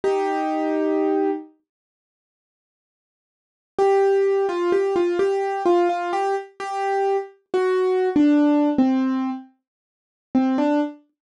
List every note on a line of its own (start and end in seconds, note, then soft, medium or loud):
0.04 1.31 D#4 medium
0.04 1.31 G4 medium
3.79 4.46 G4 medium
4.49 4.71 F4 medium
4.72 4.95 G4 medium
4.96 5.18 F4 medium
5.19 5.62 G4 medium
5.66 5.88 F4 medium
5.89 6.12 F4 medium
6.13 6.35 G4 medium
6.60 7.17 G4 medium
7.54 8.09 F#4 medium
8.16 8.70 D4 medium
8.78 9.30 C4 medium
10.35 10.57 C4 medium
10.58 10.80 D4 medium